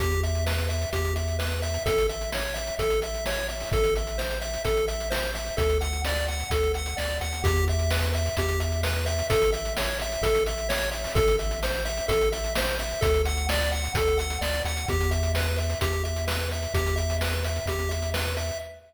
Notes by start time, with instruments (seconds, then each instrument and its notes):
0.00 synth bass 1 E2, lead 1 (square) G4, kick, closed hi-hat
0.11 closed hi-hat
0.23 lead 1 (square) E5, closed hi-hat
0.35 closed hi-hat
0.46 lead 1 (square) B4, snare
0.58 closed hi-hat
0.69 lead 1 (square) E5, closed hi-hat
0.82 closed hi-hat
0.93 synth bass 1 E2, lead 1 (square) G4, kick, closed hi-hat
1.05 closed hi-hat
1.16 lead 1 (square) E5, closed hi-hat
1.28 closed hi-hat
1.39 lead 1 (square) B4, snare
1.52 closed hi-hat
1.62 lead 1 (square) E5, closed hi-hat
1.74 closed hi-hat
1.86 synth bass 1 A1, lead 1 (square) A4, kick, closed hi-hat
1.98 closed hi-hat
2.09 lead 1 (square) E5, closed hi-hat
2.21 closed hi-hat
2.32 lead 1 (square) C#5, snare
2.54 lead 1 (square) E5, closed hi-hat
2.67 closed hi-hat
2.79 synth bass 1 A1, lead 1 (square) A4, kick, closed hi-hat
2.90 closed hi-hat
3.02 lead 1 (square) E5, closed hi-hat
3.14 closed hi-hat
3.26 lead 1 (square) C#5, snare
3.38 closed hi-hat
3.48 lead 1 (square) E5, closed hi-hat
3.60 open hi-hat
3.72 synth bass 1 A1, lead 1 (square) A4, kick, closed hi-hat
3.84 closed hi-hat
3.96 lead 1 (square) E5, closed hi-hat
4.07 closed hi-hat
4.18 lead 1 (square) C5, snare
4.31 closed hi-hat
4.41 lead 1 (square) E5, closed hi-hat
4.54 closed hi-hat
4.65 synth bass 1 A1, lead 1 (square) A4, kick, closed hi-hat
4.77 closed hi-hat
4.88 lead 1 (square) E5, closed hi-hat
5.00 closed hi-hat
5.10 lead 1 (square) C5, snare
5.23 closed hi-hat
5.35 lead 1 (square) E5, closed hi-hat
5.46 closed hi-hat
5.57 synth bass 1 D2, lead 1 (square) A4, kick, closed hi-hat
5.69 closed hi-hat
5.81 lead 1 (square) F#5, closed hi-hat
5.93 closed hi-hat
6.05 lead 1 (square) D5, snare
6.16 closed hi-hat
6.28 lead 1 (square) F#5, closed hi-hat
6.40 closed hi-hat
6.50 synth bass 1 D2, lead 1 (square) A4, kick, closed hi-hat
6.63 closed hi-hat
6.74 lead 1 (square) F#5, closed hi-hat
6.86 closed hi-hat
6.97 synth bass 1 D2, lead 1 (square) D5, snare
7.10 closed hi-hat
7.21 synth bass 1 D#2, lead 1 (square) F#5, closed hi-hat
7.33 closed hi-hat
7.44 synth bass 1 E2, lead 1 (square) G4, kick, closed hi-hat
7.56 closed hi-hat
7.68 lead 1 (square) E5, closed hi-hat
7.79 closed hi-hat
7.91 lead 1 (square) B4, snare
8.02 closed hi-hat
8.14 lead 1 (square) E5, closed hi-hat
8.26 closed hi-hat
8.37 synth bass 1 E2, lead 1 (square) G4, kick, closed hi-hat
8.48 closed hi-hat
8.60 lead 1 (square) E5, closed hi-hat
8.72 closed hi-hat
8.83 lead 1 (square) B4, snare
8.96 closed hi-hat
9.06 lead 1 (square) E5, closed hi-hat
9.19 closed hi-hat
9.30 synth bass 1 A1, lead 1 (square) A4, kick, closed hi-hat
9.42 closed hi-hat
9.52 lead 1 (square) E5, closed hi-hat
9.65 closed hi-hat
9.77 lead 1 (square) C#5, snare
10.00 lead 1 (square) E5, closed hi-hat
10.12 closed hi-hat
10.22 synth bass 1 A1, lead 1 (square) A4, kick, closed hi-hat
10.35 closed hi-hat
10.46 lead 1 (square) E5, closed hi-hat
10.58 closed hi-hat
10.69 lead 1 (square) C#5, snare
10.81 closed hi-hat
10.91 lead 1 (square) E5, closed hi-hat
11.04 open hi-hat
11.15 synth bass 1 A1, lead 1 (square) A4, kick, closed hi-hat
11.28 closed hi-hat
11.39 lead 1 (square) E5, closed hi-hat
11.51 closed hi-hat
11.63 lead 1 (square) C5, snare
11.75 closed hi-hat
11.85 lead 1 (square) E5, closed hi-hat
11.97 closed hi-hat
12.08 synth bass 1 A1, lead 1 (square) A4, kick, closed hi-hat
12.21 closed hi-hat
12.32 lead 1 (square) E5, closed hi-hat
12.44 closed hi-hat
12.55 lead 1 (square) C5, snare
12.68 closed hi-hat
12.79 lead 1 (square) E5, closed hi-hat
12.91 closed hi-hat
13.01 synth bass 1 D2, lead 1 (square) A4, kick, closed hi-hat
13.14 closed hi-hat
13.25 lead 1 (square) F#5, closed hi-hat
13.37 closed hi-hat
13.49 lead 1 (square) D5, snare
13.60 closed hi-hat
13.72 lead 1 (square) F#5, closed hi-hat
13.84 closed hi-hat
13.94 synth bass 1 D2, lead 1 (square) A4, kick, closed hi-hat
14.07 closed hi-hat
14.18 lead 1 (square) F#5, closed hi-hat
14.30 closed hi-hat
14.41 synth bass 1 D2, lead 1 (square) D5, snare
14.54 closed hi-hat
14.65 synth bass 1 D#2, lead 1 (square) F#5, closed hi-hat
14.77 closed hi-hat
14.88 synth bass 1 E2, lead 1 (square) G4, kick, closed hi-hat
15.00 closed hi-hat
15.11 lead 1 (square) E5, closed hi-hat
15.23 closed hi-hat
15.35 lead 1 (square) B4, snare
15.46 closed hi-hat
15.58 lead 1 (square) E5, closed hi-hat
15.70 closed hi-hat
15.81 synth bass 1 E2, lead 1 (square) G4, kick, closed hi-hat
15.93 closed hi-hat
16.04 lead 1 (square) E5, closed hi-hat
16.16 closed hi-hat
16.27 lead 1 (square) B4, snare
16.40 closed hi-hat
16.51 lead 1 (square) E5, closed hi-hat
16.62 closed hi-hat
16.74 synth bass 1 E2, lead 1 (square) G4, kick, closed hi-hat
16.86 closed hi-hat
16.96 lead 1 (square) E5, closed hi-hat
17.10 closed hi-hat
17.21 lead 1 (square) B4, snare
17.33 closed hi-hat
17.44 lead 1 (square) E5, closed hi-hat
17.56 closed hi-hat
17.66 synth bass 1 E2, lead 1 (square) G4, kick, closed hi-hat
17.79 closed hi-hat
17.89 lead 1 (square) E5, closed hi-hat
18.02 closed hi-hat
18.14 lead 1 (square) B4, snare
18.25 closed hi-hat
18.37 lead 1 (square) E5, closed hi-hat
18.49 closed hi-hat